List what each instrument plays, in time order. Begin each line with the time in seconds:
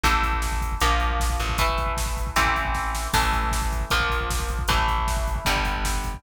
0.04 electric bass (finger) A1, overdriven guitar E3 A3, kick, closed hi-hat
0.13 kick
0.23 kick, closed hi-hat
0.33 kick
0.42 kick, snare
0.52 kick
0.61 kick, closed hi-hat
0.72 kick
0.80 electric bass (finger) A#1, overdriven guitar F3 A#3, kick, closed hi-hat
0.91 kick
1.00 kick, closed hi-hat
1.10 kick
1.20 kick, snare
1.30 kick
1.40 electric bass (finger) A1, kick, closed hi-hat
1.49 kick
1.58 overdriven guitar E3 A3, kick, closed hi-hat
1.69 kick
1.78 kick, closed hi-hat
1.86 kick
1.97 kick, snare
2.06 kick
2.17 kick, closed hi-hat
2.27 kick
2.36 electric bass (finger) A1, overdriven guitar E3 A3 C4, kick, closed hi-hat
2.45 kick
2.56 kick, closed hi-hat
2.65 kick
2.75 kick, snare
2.95 snare
3.13 electric bass (finger) A1, overdriven guitar E3 A3, kick, crash
3.22 kick
3.33 kick, closed hi-hat
3.44 kick
3.51 kick, snare
3.62 kick
3.72 kick, closed hi-hat
3.81 kick
3.90 electric bass (finger) A#1, overdriven guitar F3 A#3, kick, closed hi-hat
4.00 kick
4.10 kick, closed hi-hat
4.21 kick
4.30 kick, snare
4.40 kick
4.49 kick, closed hi-hat
4.59 kick
4.68 electric bass (finger) A1, overdriven guitar E3 A3, kick, closed hi-hat
4.78 kick
4.88 kick, closed hi-hat
4.98 kick
5.08 kick, snare
5.17 kick
5.28 kick, closed hi-hat
5.36 kick
5.45 electric bass (finger) G1, overdriven guitar D3 G3, kick, closed hi-hat
5.56 kick
5.65 kick, closed hi-hat
5.75 kick
5.85 kick, snare
5.94 kick
6.04 kick, closed hi-hat
6.14 kick